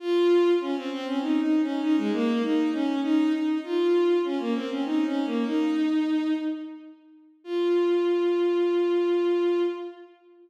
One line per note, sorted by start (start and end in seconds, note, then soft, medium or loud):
0.00 0.51 F4 loud
0.61 0.75 C#4 loud
0.76 0.90 C4 loud
0.91 1.05 C4 loud
1.06 1.20 C#4 loud
1.21 1.40 D#4 loud
1.41 1.61 D#4 medium
1.62 1.81 C#4 loud
1.82 1.96 D#4 loud
1.97 2.11 G#3 loud
2.12 2.42 A#3 loud
2.42 2.71 D#4 loud
2.73 3.00 C#4 loud
3.03 3.32 D#4 loud
3.33 3.58 D#4 medium
3.64 4.18 F4 loud
4.24 4.39 C#4 medium
4.39 4.54 A#3 medium
4.55 4.69 C4 loud
4.70 4.84 C#4 medium
4.85 5.04 D#4 loud
5.05 5.24 C#4 loud
5.25 5.44 A#3 medium
5.45 6.33 D#4 loud
7.44 9.63 F4 loud